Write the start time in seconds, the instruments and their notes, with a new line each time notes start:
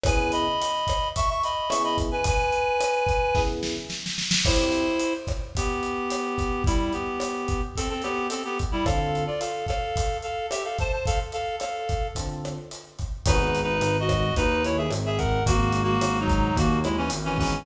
0.04 electric piano 1 C#3 B3 E4 G#4, clarinet B4 G#5, kick, cross-stick, closed hi-hat
0.32 clarinet D#5 B5, closed hi-hat
0.62 closed hi-hat
0.87 kick, cross-stick, closed hi-hat
1.16 clarinet E5 C#6, kick, closed hi-hat
1.29 clarinet E5 C#6
1.43 clarinet D#5 B5, closed hi-hat
1.69 electric piano 1 C#3 B3 E4 G#4, clarinet E5 C#6, cross-stick, closed hi-hat
1.84 clarinet D#5 B5
1.98 kick, closed hi-hat
2.12 clarinet B4 G#5
2.24 clarinet B4 G#5, kick, closed hi-hat
2.52 closed hi-hat
2.81 cross-stick, closed hi-hat
3.07 kick, closed hi-hat
3.35 electric piano 1 C#3 B3 E4 G#4, kick, snare
3.63 snare
3.90 snare
4.06 snare
4.18 snare
4.31 snare
4.45 electric piano 1 C4 E4 G4, clarinet E4 C5, kick, cross-stick, crash
4.72 closed hi-hat
5.00 closed hi-hat
5.27 kick, cross-stick, closed hi-hat
5.55 clarinet B3 G4, kick, closed hi-hat
5.83 closed hi-hat
6.10 cross-stick, closed hi-hat
6.38 kick, closed hi-hat
6.64 clarinet G3 E4, kick, closed hi-hat
6.93 clarinet B3 G4, closed hi-hat
7.20 cross-stick, closed hi-hat
7.48 kick, closed hi-hat
7.76 clarinet C4 A4, kick, closed hi-hat
7.89 clarinet C4 A4
8.02 clarinet B3 G4, cross-stick, closed hi-hat
8.30 clarinet C4 A4, closed hi-hat
8.45 clarinet B3 G4
8.59 kick, closed hi-hat
8.72 clarinet G3 E4
8.85 electric piano 1 D3 C4 F4 A4, clarinet A4 F5, kick, cross-stick, closed hi-hat
9.15 closed hi-hat
9.27 clarinet F4 D5
9.40 clarinet A4 F5, closed hi-hat
9.67 clarinet A4 F5, kick, cross-stick, closed hi-hat
9.96 kick, closed hi-hat
10.22 clarinet A4 F5, closed hi-hat
10.50 clarinet G4 E5, cross-stick, closed hi-hat
10.64 clarinet A4 F5
10.78 clarinet C5 A5, kick, closed hi-hat
10.92 clarinet C5 A5
11.06 clarinet A4 F5, kick, closed hi-hat
11.32 clarinet A4 F5, closed hi-hat
11.60 clarinet A4 F5, cross-stick, closed hi-hat
11.89 kick, closed hi-hat
12.15 electric piano 1 D3 C4 F4 A4, kick, closed hi-hat
12.45 cross-stick, closed hi-hat
12.71 closed hi-hat
12.99 kick, closed hi-hat
13.26 synth bass 1 G#1, electric piano 1 B3 D#4 F#4 G#4, clarinet D#4 B4, kick, cross-stick, closed hi-hat
13.55 closed hi-hat
13.63 clarinet D#4 B4
13.81 synth bass 1 G#1, closed hi-hat
14.00 clarinet F#4 D#5
14.09 kick, cross-stick, closed hi-hat
14.34 synth bass 1 D#2, clarinet D#4 B4, kick, closed hi-hat
14.64 clarinet E4 C#5, closed hi-hat
14.77 clarinet G#4 E5
14.91 synth bass 1 G#1, cross-stick, closed hi-hat
15.06 clarinet G#4 E5
15.18 clarinet A#4 F#5, kick, closed hi-hat
15.46 synth bass 1 G#1, clarinet A#3 F#4, kick, closed hi-hat
15.72 closed hi-hat
15.83 clarinet A#3 F#4
16.01 synth bass 1 G#1, cross-stick, closed hi-hat
16.20 clarinet F#3 D#4
16.28 kick, closed hi-hat
16.56 synth bass 1 D#2, clarinet A#3 F#4, kick, closed hi-hat
16.84 clarinet G#3 E4, cross-stick, closed hi-hat
16.97 clarinet E3 C#4
17.10 synth bass 1 G#1, closed hi-hat
17.25 clarinet E3 C#4
17.38 clarinet E3 C#4, electric piano 1 B3 D#4 F#4 G#4, kick, open hi-hat